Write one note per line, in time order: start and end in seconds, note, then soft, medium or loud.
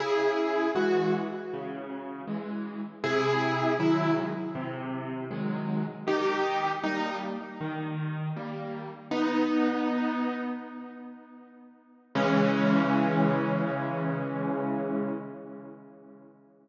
0.00 0.67 C#3 medium
0.00 0.70 E4 medium
0.00 0.70 G#4 medium
0.75 1.28 E3 medium
0.75 1.28 G#3 medium
0.75 1.13 F#4 medium
1.53 2.22 C#3 medium
2.28 2.81 E3 medium
2.28 2.81 G#3 medium
3.04 3.72 C3 medium
3.04 3.73 E4 medium
3.04 3.73 G#4 loud
3.79 4.32 D#3 medium
3.79 4.32 F#3 medium
3.79 4.32 G#3 medium
3.79 4.15 E4 medium
4.55 5.23 C3 medium
5.31 5.84 D#3 medium
5.31 5.84 F#3 medium
5.31 5.84 G#3 medium
6.07 6.75 D#3 medium
6.07 6.70 D#4 medium
6.07 6.70 G4 medium
6.84 7.37 G3 medium
6.84 7.37 A#3 medium
6.84 7.15 D#4 medium
7.61 8.29 D#3 medium
8.36 8.90 G3 medium
8.36 8.90 A#3 medium
9.11 10.41 B3 medium
9.11 10.41 D#4 loud
12.15 15.14 C#3 loud
12.15 15.14 E3 loud
12.15 15.14 G#3 loud
12.15 15.14 C#4 loud